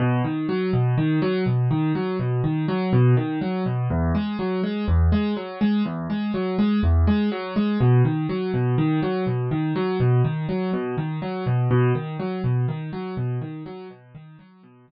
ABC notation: X:1
M:4/4
L:1/8
Q:1/4=123
K:B
V:1 name="Acoustic Grand Piano" clef=bass
B,, D, F, B,, D, F, B,, D, | F, B,, D, F, B,, D, F, B,, | E,, G, F, G, E,, G, F, G, | E,, G, F, G, E,, G, F, G, |
B,, D, F, B,, D, F, B,, D, | F, B,, D, F, B,, D, F, B,, | B,, D, F, B,, D, F, B,, D, | F, B,, D, F, B,, D, z2 |]